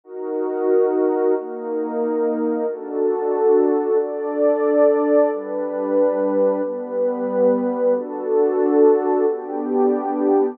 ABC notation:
X:1
M:6/8
L:1/8
Q:3/8=91
K:Db
V:1 name="Pad 2 (warm)"
[EGB]6 | [B,EB]6 | [K:D] [DFA]6 | [DAd]6 |
[G,DB]6 | [G,B,B]6 | [DFA]6 | [B,DG]6 |]